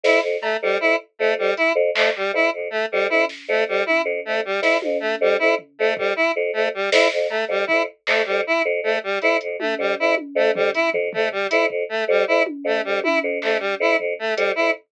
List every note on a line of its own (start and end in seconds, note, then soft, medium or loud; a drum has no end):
0.04 0.19 F2 medium
0.04 0.20 E4 medium
0.04 snare medium
0.21 0.37 F2 medium
0.41 0.57 A3 medium
0.41 cowbell medium
0.62 0.78 F2 medium
0.62 0.78 G3 medium
0.80 0.95 F2 medium
0.80 0.96 E4 medium
1.19 1.35 F2 medium
1.19 1.34 A3 medium
1.36 1.51 F2 medium
1.36 1.54 G3 medium
1.57 1.73 E4 medium
1.57 closed hi-hat medium
1.75 1.90 F2 medium
1.95 2.11 F2 medium
1.95 2.10 A3 medium
1.95 clap loud
2.16 2.31 G3 medium
2.33 2.48 F2 medium
2.33 2.50 E4 medium
2.53 2.68 F2 medium
2.70 2.86 A3 medium
2.92 3.08 F2 medium
2.92 3.07 G3 medium
3.09 3.24 F2 medium
3.09 3.25 E4 medium
3.09 high tom medium
3.29 snare medium
3.48 3.64 F2 medium
3.48 3.64 A3 medium
3.67 3.82 F2 medium
3.67 3.84 G3 medium
3.86 4.02 E4 medium
3.86 high tom medium
4.05 4.20 F2 medium
4.25 4.42 F2 medium
4.25 4.41 A3 medium
4.45 4.60 G3 medium
4.62 4.77 F2 medium
4.62 4.77 E4 medium
4.62 snare medium
4.82 4.97 F2 medium
4.82 high tom medium
5.00 5.15 A3 medium
5.21 5.36 F2 medium
5.21 5.37 G3 medium
5.39 5.55 F2 medium
5.39 5.55 E4 medium
5.59 floor tom medium
5.79 5.95 F2 medium
5.79 5.94 A3 medium
5.96 6.11 F2 medium
5.96 6.13 G3 medium
5.96 kick loud
6.16 6.31 E4 medium
6.36 6.51 F2 medium
6.53 6.69 F2 medium
6.53 6.68 A3 medium
6.74 6.90 G3 medium
6.92 7.07 F2 medium
6.92 7.08 E4 medium
6.92 snare loud
7.12 7.27 F2 medium
7.29 7.45 A3 medium
7.29 cowbell medium
7.48 7.64 F2 medium
7.48 7.65 G3 medium
7.67 7.86 F2 medium
7.67 7.82 E4 medium
7.67 kick medium
8.07 8.23 F2 medium
8.07 8.22 A3 medium
8.07 clap loud
8.25 8.43 F2 medium
8.25 8.41 G3 medium
8.47 8.62 E4 medium
8.65 8.80 F2 medium
8.81 8.96 F2 medium
8.81 8.99 A3 medium
9.03 9.19 G3 medium
9.22 9.38 F2 medium
9.22 9.37 E4 medium
9.22 closed hi-hat medium
9.41 9.56 F2 medium
9.41 closed hi-hat medium
9.59 9.75 A3 medium
9.59 high tom medium
9.78 9.94 F2 medium
9.78 9.95 G3 medium
9.99 10.14 F2 medium
9.99 10.15 E4 medium
10.17 high tom medium
10.35 10.51 F2 medium
10.35 10.51 A3 medium
10.54 10.69 F2 medium
10.54 10.71 G3 medium
10.54 floor tom loud
10.74 10.90 E4 medium
10.74 closed hi-hat medium
10.94 11.09 F2 medium
10.94 floor tom medium
11.13 11.29 F2 medium
11.13 11.29 A3 medium
11.13 floor tom loud
11.32 11.47 G3 medium
11.50 11.67 F2 medium
11.50 11.66 E4 medium
11.50 closed hi-hat medium
11.68 11.84 F2 medium
11.68 kick medium
11.89 12.04 A3 medium
12.08 12.23 F2 medium
12.08 12.25 G3 medium
12.27 12.42 F2 medium
12.27 12.43 E4 medium
12.46 high tom loud
12.64 12.80 F2 medium
12.64 12.81 A3 medium
12.84 13.01 F2 medium
12.84 13.00 G3 medium
13.04 13.19 E4 medium
13.04 high tom loud
13.23 13.39 F2 medium
13.42 13.57 F2 medium
13.42 13.57 A3 medium
13.42 clap medium
13.59 13.75 G3 medium
13.80 13.95 F2 medium
13.80 13.96 E4 medium
13.98 14.14 F2 medium
13.98 floor tom medium
14.19 14.34 A3 medium
14.36 14.53 F2 medium
14.36 14.52 G3 medium
14.36 closed hi-hat medium
14.55 14.72 F2 medium
14.55 14.71 E4 medium